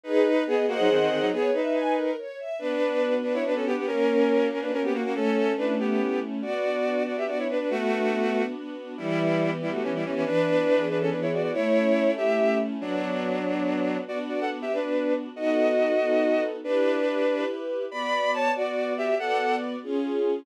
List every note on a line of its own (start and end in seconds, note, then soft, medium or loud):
0.04 0.44 D#4 medium
0.04 0.23 G#4 loud
0.04 0.44 B4 medium
0.25 0.44 B4 medium
0.46 0.66 B3 medium
0.46 0.66 G#4 medium
0.46 0.66 D#5 medium
0.67 0.77 A#3 medium
0.67 0.77 F#4 medium
0.67 1.25 G#4 loud
0.67 1.25 C5 loud
0.67 1.25 D#5 medium
0.67 1.25 F#5 medium
0.79 0.89 F#3 medium
0.79 0.89 D#4 medium
0.89 0.99 D#3 medium
0.89 0.99 C4 medium
1.00 1.10 D#3 medium
1.00 1.10 C4 medium
1.10 1.20 D#3 medium
1.10 1.20 C4 medium
1.21 1.31 F#3 medium
1.21 1.31 D#4 medium
1.32 1.51 B3 medium
1.32 1.51 G#4 medium
1.32 1.51 C#5 medium
1.53 2.10 D#4 medium
1.53 2.10 B4 medium
1.53 1.73 E5 medium
1.73 1.92 G#5 medium
1.95 2.15 A#4 medium
2.18 2.37 C#5 medium
2.38 2.57 E5 medium
2.59 3.44 B3 loud
2.59 3.14 D4 medium
2.59 3.14 B4 medium
2.80 3.22 D4 medium
3.01 3.82 F#4 medium
3.23 3.33 D4 medium
3.23 3.65 D4 medium
3.23 3.33 B4 medium
3.34 3.44 E4 medium
3.34 3.44 C#5 medium
3.44 3.85 B3 medium
3.44 3.55 D4 medium
3.44 3.55 B4 medium
3.55 3.65 C#4 medium
3.55 3.65 A4 medium
3.65 3.76 B3 medium
3.65 3.85 D4 medium
3.65 3.76 G4 medium
3.76 3.86 B3 medium
3.76 3.86 G4 medium
3.86 4.71 A#3 loud
3.86 4.47 C#4 medium
3.86 4.47 A#4 medium
4.08 4.50 C#4 medium
4.29 5.10 F#4 medium
4.50 4.60 C#4 medium
4.50 4.93 C#4 medium
4.50 4.60 A#4 medium
4.61 4.71 D4 medium
4.61 4.71 B4 medium
4.71 5.12 A#3 medium
4.71 4.82 C#4 medium
4.71 4.82 A#4 medium
4.83 4.93 B3 medium
4.83 4.93 G4 medium
4.93 5.03 A#3 medium
4.93 5.14 C#4 medium
4.93 5.03 F#4 medium
5.04 5.14 A#3 medium
5.04 5.14 F#4 medium
5.14 5.99 A3 loud
5.14 5.53 C#4 medium
5.14 5.53 A4 medium
5.35 5.78 C#4 medium
5.57 5.75 D4 medium
5.57 6.38 E4 medium
5.57 5.75 B4 medium
5.79 6.20 B3 medium
5.79 6.21 C#4 medium
5.79 6.20 G4 medium
6.00 6.40 A3 medium
6.21 6.41 C#4 medium
6.42 7.27 B3 medium
6.42 7.03 F#4 medium
6.42 7.03 D5 medium
6.64 7.06 D4 medium
6.85 7.66 F#4 medium
7.06 7.49 D4 medium
7.06 7.16 F#4 medium
7.06 7.16 D5 medium
7.17 7.27 G4 medium
7.17 7.27 E5 medium
7.27 7.68 B3 medium
7.27 7.38 F#4 medium
7.27 7.38 D5 medium
7.38 7.48 E4 medium
7.38 7.48 C#5 medium
7.49 7.59 D4 medium
7.49 7.69 D4 medium
7.49 7.59 B4 medium
7.59 7.69 D4 medium
7.59 7.69 B4 medium
7.70 8.42 A3 medium
7.70 8.54 B3 medium
7.70 8.42 F#4 medium
7.91 8.32 D4 medium
8.13 8.94 F#4 medium
8.33 8.76 D4 medium
8.55 8.95 B3 medium
8.77 8.97 D4 medium
8.97 9.82 E3 medium
8.97 9.50 G3 medium
8.97 9.50 E4 medium
9.20 9.61 B3 medium
9.40 10.20 G4 medium
9.62 9.72 G3 medium
9.62 10.03 B3 medium
9.62 9.72 E4 medium
9.72 9.82 A3 medium
9.72 9.82 F#4 medium
9.82 10.23 E3 medium
9.82 9.93 E3 medium
9.82 9.93 C#4 medium
9.94 10.04 G3 medium
9.94 10.04 E4 medium
10.04 10.14 E3 medium
10.04 10.24 B3 medium
10.04 10.14 C#4 medium
10.15 10.25 E3 medium
10.15 10.25 C#4 medium
10.24 11.10 E3 medium
10.24 10.85 D4 medium
10.24 10.85 B4 loud
10.46 10.89 B3 medium
10.68 11.48 G#4 medium
10.89 11.31 B3 medium
10.89 10.99 D4 medium
10.89 10.99 B4 medium
10.99 11.09 C#4 medium
10.99 11.09 A4 medium
11.10 11.51 E3 medium
11.10 11.20 D4 medium
11.10 11.20 B4 medium
11.21 11.31 E4 medium
11.21 11.31 C#5 medium
11.32 11.52 B3 medium
11.32 11.42 F#4 medium
11.32 11.42 D5 medium
11.42 11.52 F#4 medium
11.42 11.52 D5 medium
11.53 12.37 A3 medium
11.53 12.11 E4 medium
11.53 12.11 C#5 medium
11.73 12.16 C#4 medium
11.96 12.77 E4 medium
12.16 12.59 C#4 medium
12.16 12.58 G4 medium
12.16 12.58 E5 medium
12.38 12.78 A3 medium
12.59 12.79 C#4 medium
12.81 13.98 F#3 medium
12.81 13.38 B3 medium
12.81 13.38 D4 medium
12.81 13.98 D4 medium
12.81 13.38 F#4 loud
13.45 14.02 B3 medium
13.45 14.02 D4 medium
13.45 14.02 F#4 medium
14.08 14.65 B3 medium
14.08 14.65 D4 medium
14.08 14.65 F#4 medium
14.08 14.18 F#4 medium
14.08 14.18 D5 medium
14.29 14.39 F#4 medium
14.29 14.39 D5 medium
14.40 14.50 A4 medium
14.40 14.50 F#5 medium
14.62 14.72 G4 medium
14.62 14.72 E5 medium
14.72 15.29 B3 medium
14.72 15.13 D4 medium
14.72 15.29 D4 medium
14.72 15.29 F#4 medium
14.72 15.13 B4 medium
15.35 15.93 B3 medium
15.35 15.93 D#4 medium
15.35 15.93 F#4 medium
15.35 16.44 F#4 medium
15.35 15.93 A4 medium
15.35 16.44 D#5 medium
15.99 16.56 B3 medium
15.99 16.56 D#4 medium
15.99 16.56 F#4 medium
15.99 16.56 A4 medium
16.64 17.45 D4 medium
16.64 17.21 E4 medium
16.64 17.21 G4 medium
16.64 17.45 B4 medium
16.64 17.21 B4 medium
17.27 17.84 E4 medium
17.27 17.84 G4 medium
17.27 17.84 B4 medium
17.91 18.49 B3 medium
17.91 18.49 F#4 medium
17.91 18.31 D5 medium
17.91 18.49 D5 medium
17.91 18.31 B5 medium
18.34 18.51 C#5 medium
18.34 18.51 A5 medium
18.55 19.12 B3 medium
18.55 19.12 F#4 medium
18.55 18.93 F#4 medium
18.55 19.12 D5 medium
18.55 18.93 D5 medium
18.97 19.15 G4 medium
18.97 19.15 E5 medium
19.18 19.76 B3 medium
19.18 19.76 F#4 medium
19.18 19.55 A4 medium
19.18 19.76 D5 medium
19.18 19.55 F#5 medium
19.83 20.40 C#4 medium
19.83 20.40 F4 medium
19.83 20.40 G#4 medium